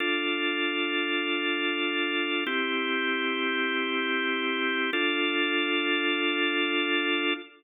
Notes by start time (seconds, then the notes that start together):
0.00 D4 F4 A4
2.47 C4 E4 G4
4.93 D4 F4 A4